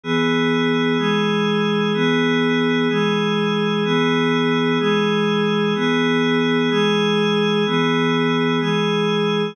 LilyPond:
\new Staff { \time 6/8 \key e \major \tempo 4. = 63 <e b gis'>4. <e gis gis'>4. | <e b gis'>4. <e gis gis'>4. | <e b gis'>4. <e gis gis'>4. | <e b gis'>4. <e gis gis'>4. |
<e b gis'>4. <e gis gis'>4. | }